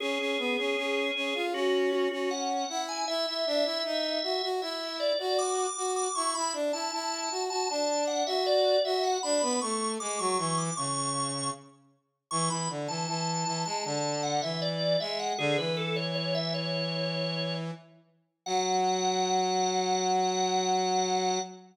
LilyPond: <<
  \new Staff \with { instrumentName = "Drawbar Organ" } { \time 4/4 \key fis \minor \tempo 4 = 78 gis'2 fis'8 fis'16 fis'16 fis''8. gis''16 | e''2 e''8 d''16 d''16 d'''8. d'''16 | cis'''16 b''16 r16 a''16 a''8. a''16 a''8 fis''16 e''16 d''8 e''16 fis''16 | b''8 cis'''8 d'''16 cis'''16 cis'''16 d'''16 cis'''4 r4 |
cis'''16 b''16 r16 a''16 a''8. a''16 a''8 fis''16 e''16 d''8 e''16 fis''16 | gis'16 b'16 a'16 cis''16 cis''16 e''16 cis''4. r4 | fis''1 | }
  \new Staff \with { instrumentName = "Brass Section" } { \time 4/4 \key fis \minor cis'16 cis'16 b16 cis'16 cis'8 cis'16 eis'16 cis'8. cis'8. e'8 | e'16 e'16 d'16 e'16 dis'8 fis'16 fis'16 e'8. fis'8. fis'8 | e'16 e'16 d'16 e'16 e'8 fis'16 fis'16 d'8. fis'8. fis'8 | d'16 b16 a8 gis16 fis16 e8 cis4 r4 |
e16 e16 d16 e16 e8 e16 gis16 d8. e8. gis8 | d16 e2.~ e16 r8 | fis1 | }
>>